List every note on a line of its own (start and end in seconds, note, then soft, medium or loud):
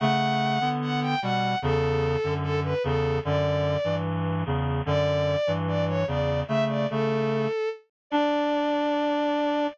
0.00 0.58 C#3 medium
0.00 0.58 A3 medium
0.00 0.69 F#5 loud
0.60 1.15 D3 medium
0.60 1.15 B3 medium
0.82 1.00 F#5 medium
1.02 1.20 G5 medium
1.22 1.55 B2 medium
1.22 1.55 G3 medium
1.22 1.58 F#5 medium
1.62 2.17 E2 medium
1.62 2.17 C#3 medium
1.62 2.34 A4 loud
2.24 2.74 F#2 medium
2.24 2.74 D3 medium
2.43 2.60 A4 loud
2.64 2.83 B4 medium
2.84 3.19 E2 medium
2.84 3.19 C#3 medium
2.84 3.18 A4 medium
3.25 3.77 F#2 medium
3.25 3.77 D3 medium
3.25 3.95 D5 loud
3.84 4.43 G2 medium
3.84 4.43 E3 medium
4.46 4.81 E2 medium
4.46 4.81 C#3 medium
4.86 5.36 F#2 medium
4.86 5.36 D3 medium
4.86 5.52 D5 loud
5.47 6.04 G2 medium
5.47 6.04 E3 medium
5.68 5.85 D5 loud
5.88 6.06 C#5 loud
6.07 6.43 E2 medium
6.07 6.43 C#3 medium
6.07 6.40 D5 medium
6.48 6.86 C#3 medium
6.48 6.86 A3 medium
6.48 6.64 E5 loud
6.68 6.87 D5 medium
6.90 7.47 C#3 medium
6.90 7.47 A3 medium
6.90 7.69 A4 medium
8.10 9.67 D4 loud
8.10 9.66 D5 loud